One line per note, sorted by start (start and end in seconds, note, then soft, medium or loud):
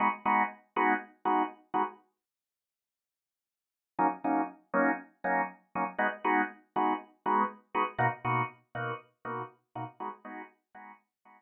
0.00 0.08 G#3 medium
0.00 0.08 B3 medium
0.00 0.08 D#4 medium
0.00 0.08 F#4 medium
0.25 0.43 G#3 medium
0.25 0.43 B3 medium
0.25 0.43 D#4 medium
0.25 0.43 F#4 medium
0.76 0.94 G#3 medium
0.76 0.94 B3 medium
0.76 0.94 D#4 medium
0.76 0.94 F#4 medium
1.25 1.43 G#3 medium
1.25 1.43 B3 medium
1.25 1.43 D#4 medium
1.25 1.43 F#4 medium
1.74 1.83 G#3 medium
1.74 1.83 B3 medium
1.74 1.83 D#4 medium
1.74 1.83 F#4 medium
3.99 4.07 F#3 medium
3.99 4.07 A#3 medium
3.99 4.07 C#4 medium
3.99 4.07 D#4 medium
4.24 4.42 F#3 medium
4.24 4.42 A#3 medium
4.24 4.42 C#4 medium
4.24 4.42 D#4 medium
4.74 4.91 F#3 medium
4.74 4.91 A#3 medium
4.74 4.91 C#4 medium
4.74 4.91 D#4 medium
5.24 5.42 F#3 medium
5.24 5.42 A#3 medium
5.24 5.42 C#4 medium
5.24 5.42 D#4 medium
5.75 5.84 F#3 medium
5.75 5.84 A#3 medium
5.75 5.84 C#4 medium
5.75 5.84 D#4 medium
5.99 6.07 G#3 medium
5.99 6.07 B3 medium
5.99 6.07 D#4 medium
5.99 6.07 F#4 medium
6.24 6.42 G#3 medium
6.24 6.42 B3 medium
6.24 6.42 D#4 medium
6.24 6.42 F#4 medium
6.76 6.93 G#3 medium
6.76 6.93 B3 medium
6.76 6.93 D#4 medium
6.76 6.93 F#4 medium
7.26 7.43 G#3 medium
7.26 7.43 B3 medium
7.26 7.43 D#4 medium
7.26 7.43 F#4 medium
7.74 7.83 G#3 medium
7.74 7.83 B3 medium
7.74 7.83 D#4 medium
7.74 7.83 F#4 medium
7.98 8.07 B2 medium
7.98 8.07 A#3 medium
7.98 8.07 D#4 medium
7.98 8.07 F#4 medium
8.24 8.42 B2 medium
8.24 8.42 A#3 medium
8.24 8.42 D#4 medium
8.24 8.42 F#4 medium
8.75 8.92 B2 medium
8.75 8.92 A#3 medium
8.75 8.92 D#4 medium
8.75 8.92 F#4 medium
9.25 9.42 B2 medium
9.25 9.42 A#3 medium
9.25 9.42 D#4 medium
9.25 9.42 F#4 medium
9.75 9.84 B2 medium
9.75 9.84 A#3 medium
9.75 9.84 D#4 medium
9.75 9.84 F#4 medium
10.00 10.09 G#3 medium
10.00 10.09 B3 medium
10.00 10.09 D#4 medium
10.00 10.09 F#4 medium
10.25 10.42 G#3 medium
10.25 10.42 B3 medium
10.25 10.42 D#4 medium
10.25 10.42 F#4 medium
10.74 10.92 G#3 medium
10.74 10.92 B3 medium
10.74 10.92 D#4 medium
10.74 10.92 F#4 medium
11.25 11.42 G#3 medium
11.25 11.42 B3 medium
11.25 11.42 D#4 medium
11.25 11.42 F#4 medium